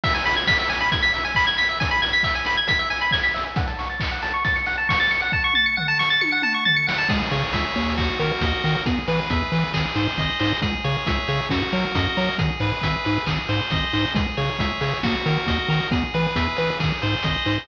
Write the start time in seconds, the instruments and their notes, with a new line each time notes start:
0.04 lead 1 (square) E5, kick, crash
0.13 lead 1 (square) G#5, closed hi-hat
0.26 lead 1 (square) B5, open hi-hat
0.36 lead 1 (square) G#6, closed hi-hat
0.47 lead 1 (square) B6, kick, snare
0.59 lead 1 (square) E5, closed hi-hat
0.69 lead 1 (square) G#5, open hi-hat
0.80 lead 1 (square) B5, closed hi-hat
0.92 lead 1 (square) G#6, kick, closed hi-hat
1.03 lead 1 (square) B6, closed hi-hat
1.14 lead 1 (square) E5, open hi-hat
1.24 lead 1 (square) G#5, closed hi-hat
1.35 lead 1 (square) B5, kick, clap
1.47 lead 1 (square) G#6, closed hi-hat
1.58 lead 1 (square) B6, open hi-hat
1.68 lead 1 (square) E5, closed hi-hat
1.80 lead 1 (square) G#5, kick, closed hi-hat
1.91 lead 1 (square) B5, closed hi-hat
2.02 lead 1 (square) G#6, open hi-hat
2.13 lead 1 (square) B6, closed hi-hat
2.23 lead 1 (square) E5, kick, clap
2.34 lead 1 (square) G#5, closed hi-hat
2.45 lead 1 (square) B5, open hi-hat
2.57 lead 1 (square) G#6, closed hi-hat
2.67 lead 1 (square) B6, kick, closed hi-hat
2.79 lead 1 (square) E5, closed hi-hat
2.90 lead 1 (square) G#5, open hi-hat
3.01 lead 1 (square) B5, closed hi-hat
3.11 lead 1 (square) G#6, kick, snare
3.24 lead 1 (square) B6, closed hi-hat
3.34 lead 1 (square) E5, open hi-hat
3.45 lead 1 (square) G#5, closed hi-hat
3.56 lead 1 (square) F#5, kick, closed hi-hat
3.67 lead 1 (square) A5, closed hi-hat
3.79 lead 1 (square) C#6, open hi-hat
3.89 lead 1 (square) A6, closed hi-hat
4.00 lead 1 (square) C#7, kick, clap
4.11 lead 1 (square) F#5
4.22 lead 1 (square) A5, open hi-hat
4.34 lead 1 (square) C#6, closed hi-hat
4.44 lead 1 (square) A6, kick, closed hi-hat
4.56 lead 1 (square) C#7, closed hi-hat
4.66 lead 1 (square) F#5, open hi-hat
4.77 lead 1 (square) A5, closed hi-hat
4.89 lead 1 (square) C#6, kick, snare
5.00 lead 1 (square) A6, closed hi-hat
5.11 lead 1 (square) C#7, open hi-hat
5.22 lead 1 (square) F#5, closed hi-hat
5.32 lead 1 (square) A5, kick
5.44 lead 1 (square) C#6
5.53 lead 1 (square) A6, mid tom
5.66 lead 1 (square) C#7
5.77 lead 1 (square) F#5, floor tom
5.88 lead 1 (square) A5
5.99 lead 1 (square) C#6, snare
6.10 lead 1 (square) A6
6.21 lead 1 (square) C#7, high tom
6.32 lead 1 (square) F#5
6.42 lead 1 (square) A5, mid tom
6.54 lead 1 (square) C#6
6.65 lead 1 (square) A6, floor tom
6.76 lead 1 (square) C#7
6.87 lead 1 (square) F#5, snare
6.98 lead 1 (square) A5
7.09 synth bass 1 C#2, lead 1 (square) G#4, kick, crash
7.31 synth bass 1 C#3, lead 1 (square) C#5, open hi-hat
7.53 synth bass 1 C#2, lead 1 (square) E5, kick, closed hi-hat
7.76 synth bass 1 D#2, lead 1 (square) C#5, open hi-hat
7.97 lead 1 (square) F#4, kick, clap
8.19 synth bass 1 D#3, lead 1 (square) A#4, open hi-hat
8.41 synth bass 1 D#2, lead 1 (square) D#5, kick, closed hi-hat
8.64 synth bass 1 D#3, lead 1 (square) A#4, open hi-hat
8.86 synth bass 1 E2, lead 1 (square) G#4, kick, closed hi-hat
9.08 synth bass 1 E3, lead 1 (square) B4, open hi-hat
9.30 synth bass 1 E2, lead 1 (square) E5, kick, closed hi-hat
9.52 synth bass 1 E3, lead 1 (square) B4, open hi-hat
9.74 synth bass 1 G#1, lead 1 (square) G#4, kick, clap
9.95 synth bass 1 G#2, lead 1 (square) C5, open hi-hat
10.18 synth bass 1 G#1, lead 1 (square) D#5, kick, closed hi-hat
10.40 synth bass 1 G#2, lead 1 (square) C5, open hi-hat
10.62 synth bass 1 C#2, lead 1 (square) G#4, kick, closed hi-hat
10.84 synth bass 1 C#3, lead 1 (square) C#5, open hi-hat
11.06 synth bass 1 C#2, lead 1 (square) E5, kick, closed hi-hat
11.28 synth bass 1 C#3, lead 1 (square) C#5, open hi-hat
11.49 synth bass 1 F#2, lead 1 (square) F#4, kick, snare
11.72 synth bass 1 F#3, lead 1 (square) A#4, open hi-hat
11.95 synth bass 1 F#2, lead 1 (square) D#5, kick, closed hi-hat
12.17 synth bass 1 F#3, lead 1 (square) A#4, open hi-hat
12.38 synth bass 1 G#1, lead 1 (square) G#4, kick, closed hi-hat
12.60 synth bass 1 G#2, lead 1 (square) B4, open hi-hat
12.82 synth bass 1 G#1, lead 1 (square) E5, kick, closed hi-hat
13.05 synth bass 1 G#2, lead 1 (square) B4, open hi-hat
13.26 synth bass 1 G#1, lead 1 (square) G#4, kick, clap
13.49 synth bass 1 G#2, lead 1 (square) C5, open hi-hat
13.70 synth bass 1 G#1, lead 1 (square) D#5, kick, closed hi-hat
13.93 synth bass 1 G#2, lead 1 (square) C5, open hi-hat
14.15 synth bass 1 C#2, lead 1 (square) G#4, kick, closed hi-hat
14.37 synth bass 1 C#3, lead 1 (square) C#5, open hi-hat
14.59 synth bass 1 C#2, lead 1 (square) E5, kick, closed hi-hat
14.81 synth bass 1 C#3, lead 1 (square) C#5, open hi-hat
15.03 synth bass 1 D#2, lead 1 (square) F#4, kick, snare
15.26 synth bass 1 D#3, lead 1 (square) A#4, open hi-hat
15.46 synth bass 1 D#2, lead 1 (square) D#5, kick, closed hi-hat
15.68 synth bass 1 D#3, lead 1 (square) A#4, open hi-hat
15.91 synth bass 1 E2, lead 1 (square) G#4, kick, closed hi-hat
16.14 synth bass 1 E3, lead 1 (square) B4, open hi-hat
16.36 synth bass 1 E2, lead 1 (square) E5, kick, closed hi-hat
16.56 synth bass 1 E3, lead 1 (square) B4, open hi-hat
16.80 synth bass 1 G#1, lead 1 (square) G#4, kick, clap
17.02 synth bass 1 G#2, lead 1 (square) C5, open hi-hat
17.23 synth bass 1 G#1, lead 1 (square) D#5, kick, closed hi-hat
17.45 synth bass 1 G#2, lead 1 (square) C5, open hi-hat